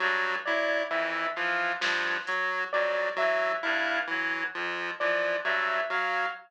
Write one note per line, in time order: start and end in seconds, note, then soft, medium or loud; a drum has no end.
0.00 0.37 G2 medium
0.00 0.36 F#3 medium
0.45 0.82 F#3 medium
0.45 0.84 E4 medium
0.45 0.82 D5 medium
0.90 1.27 F2 medium
0.90 1.27 E3 medium
0.90 1.27 E5 medium
1.36 1.73 E3 medium
1.36 1.73 F3 medium
1.36 1.73 F5 medium
1.81 2.17 G2 medium
1.81 2.17 F3 medium
1.81 snare loud
2.26 2.63 F#3 medium
2.26 2.65 F#3 medium
2.26 closed hi-hat medium
2.73 3.09 F2 medium
2.73 3.10 F#3 medium
2.73 3.09 D5 medium
3.16 3.56 E3 medium
3.16 3.53 F#3 medium
3.16 3.55 E5 medium
3.63 4.01 G2 medium
3.63 3.99 E4 medium
3.63 4.00 F5 medium
3.63 cowbell medium
4.07 4.44 E3 medium
4.07 4.46 F#3 medium
4.55 4.91 F2 medium
4.55 4.91 F3 medium
5.00 5.36 E3 medium
5.00 5.37 F3 medium
5.00 5.36 D5 medium
5.44 5.80 G2 medium
5.44 5.81 F#3 medium
5.44 5.82 E5 medium
5.90 6.26 F#3 medium
5.90 6.27 F#3 medium
5.90 6.27 F5 medium